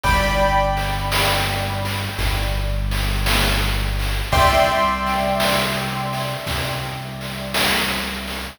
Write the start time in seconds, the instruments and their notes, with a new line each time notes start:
0.03 synth bass 1 G1, acoustic grand piano D5 G5 B5, kick, snare
0.77 snare
1.12 snare
1.85 snare
2.18 synth bass 1 G1, kick, snare
2.91 snare
3.26 snare
3.99 snare
4.32 synth bass 1 C2, acoustic grand piano D5 E5 G5 C6, kick, snare
5.06 snare
5.40 snare
6.13 snare
6.46 synth bass 1 C2, kick, snare
7.21 snare
7.54 snare
8.27 snare